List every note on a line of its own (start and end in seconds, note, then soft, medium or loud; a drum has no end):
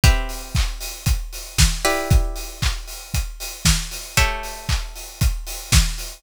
0.04 1.76 C4 medium
0.04 1.76 G4 medium
0.04 1.76 B4 medium
0.04 1.76 E5 medium
0.04 kick loud
0.04 closed hi-hat loud
0.29 open hi-hat medium
0.55 kick loud
0.55 clap loud
0.80 open hi-hat loud
1.06 kick loud
1.06 closed hi-hat loud
1.33 open hi-hat medium
1.58 kick loud
1.58 snare loud
1.85 4.13 E4 medium
1.85 4.13 G4 medium
1.85 4.13 B4 medium
1.85 4.13 D5 medium
1.85 open hi-hat loud
2.10 kick loud
2.10 closed hi-hat loud
2.36 open hi-hat loud
2.62 kick medium
2.62 clap loud
2.87 open hi-hat medium
3.14 kick medium
3.14 closed hi-hat loud
3.40 open hi-hat loud
3.65 kick loud
3.65 snare loud
3.91 open hi-hat loud
4.17 6.20 A3 medium
4.17 6.20 G4 medium
4.17 6.20 C#5 medium
4.17 6.20 E5 medium
4.17 kick loud
4.17 closed hi-hat loud
4.43 open hi-hat medium
4.69 kick medium
4.69 clap loud
4.95 open hi-hat medium
5.21 kick loud
5.21 closed hi-hat loud
5.47 open hi-hat loud
5.72 kick loud
5.72 snare loud
5.98 open hi-hat loud